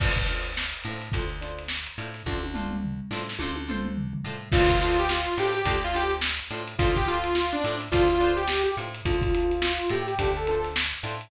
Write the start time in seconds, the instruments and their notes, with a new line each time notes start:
0.00 electric bass (finger) D2, pizzicato strings D4 F4 A4 C5, kick, crash
0.16 kick, closed hi-hat
0.27 pizzicato strings D4 F4 A4, closed hi-hat
0.32 pizzicato strings C5
0.44 closed hi-hat
0.57 snare
0.74 closed hi-hat
0.84 electric bass (finger) A2, pizzicato strings D4 F4, closed hi-hat
0.88 pizzicato strings A4 C5
1.01 closed hi-hat
1.12 electric bass (finger) D2, pizzicato strings D4 F4 A4, kick, closed hi-hat
1.17 pizzicato strings C5
1.29 closed hi-hat
1.41 pizzicato strings D4 F4 A4 C5, closed hi-hat
1.58 closed hi-hat
1.68 snare
1.87 closed hi-hat
1.98 electric bass (finger) A2, pizzicato strings D4 F4 A4 C5, closed hi-hat
2.14 snare, closed hi-hat
2.26 electric bass (finger) D2, pizzicato strings D4 F4 A4, kick, high tom
2.30 pizzicato strings C5
2.43 high tom
2.54 pizzicato strings D4 F4 A4 C5, mid tom
2.70 mid tom
2.84 floor tom
3.11 electric bass (finger) A2, pizzicato strings D4 F4 A4 C5, snare
3.29 snare
3.39 electric bass (finger) D2, pizzicato strings D4 F4 A4, high tom
3.43 pizzicato strings C5
3.56 high tom
3.67 pizzicato strings D4 F4 A4 C5, mid tom
3.84 mid tom
3.97 floor tom
4.13 floor tom
4.24 electric bass (finger) A2, pizzicato strings D4 F4 A4 C5
4.52 electric bass (finger) D2, pizzicato strings D4 F4 A4, lead 2 (sawtooth) F4, kick, crash
4.56 pizzicato strings C5
4.68 lead 2 (sawtooth) F4, kick, closed hi-hat
4.80 pizzicato strings D4 F4 A4, lead 2 (sawtooth) F4, closed hi-hat
4.85 pizzicato strings C5
4.96 lead 2 (sawtooth) G4, closed hi-hat
5.09 lead 2 (sawtooth) F4, snare
5.25 closed hi-hat
5.38 electric bass (finger) A2, pizzicato strings D4 F4 A4 C5, lead 2 (sawtooth) G4, closed hi-hat
5.53 lead 2 (sawtooth) G4, closed hi-hat
5.65 electric bass (finger) D2, pizzicato strings D4 F4 A4 C5, kick, closed hi-hat
5.81 lead 2 (sawtooth) F4, closed hi-hat
5.94 pizzicato strings D4 F4 A4 C5, lead 2 (sawtooth) G4, closed hi-hat
6.11 closed hi-hat
6.21 snare
6.39 snare, closed hi-hat
6.51 electric bass (finger) A2, pizzicato strings D4 F4 A4 C5, closed hi-hat
6.68 closed hi-hat
6.79 electric bass (finger) D2, pizzicato strings D4 F4 A4, lead 2 (sawtooth) F4, kick, closed hi-hat
6.83 pizzicato strings C5
6.96 lead 2 (sawtooth) G4, kick, closed hi-hat
7.07 pizzicato strings D4 F4 A4 C5, lead 2 (sawtooth) F4, snare, closed hi-hat
7.24 closed hi-hat
7.35 lead 2 (sawtooth) F4, snare
7.52 lead 2 (sawtooth) D4, closed hi-hat
7.64 electric bass (finger) A2, pizzicato strings D4 F4 A4 C5, closed hi-hat
7.81 snare, closed hi-hat
7.92 electric bass (finger) D2, pizzicato strings D4 F4 A4 C5, lead 2 (sawtooth) F4, kick, closed hi-hat
8.08 lead 2 (sawtooth) F4, closed hi-hat
8.20 pizzicato strings D4 F4 A4 C5, closed hi-hat
8.36 lead 2 (sawtooth) G4, closed hi-hat
8.48 snare
8.63 lead 2 (sawtooth) G4, closed hi-hat
8.77 electric bass (finger) A2, pizzicato strings D4 F4 A4 C5, closed hi-hat
8.94 closed hi-hat
9.05 electric bass (finger) D2, pizzicato strings D4 F4 A4 C5, lead 2 (sawtooth) F4, kick, closed hi-hat
9.21 lead 2 (sawtooth) F4, kick, closed hi-hat
9.34 pizzicato strings D4 F4 A4 C5, lead 2 (sawtooth) F4, closed hi-hat
9.50 lead 2 (sawtooth) F4, closed hi-hat
9.62 lead 2 (sawtooth) F4, snare
9.79 closed hi-hat
9.89 electric bass (finger) A2, pizzicato strings D4 F4 A4 C5, lead 2 (sawtooth) G4, closed hi-hat
10.07 lead 2 (sawtooth) G4, closed hi-hat
10.19 electric bass (finger) D2, pizzicato strings D4 F4 A4 C5, kick, closed hi-hat
10.37 lead 2 (sawtooth) A4, closed hi-hat
10.47 pizzicato strings D4 F4 A4 C5, lead 2 (sawtooth) A4, closed hi-hat
10.64 snare, closed hi-hat
10.76 snare
10.94 closed hi-hat
11.03 electric bass (finger) A2, pizzicato strings D4 F4 A4 C5, snare, closed hi-hat
11.21 closed hi-hat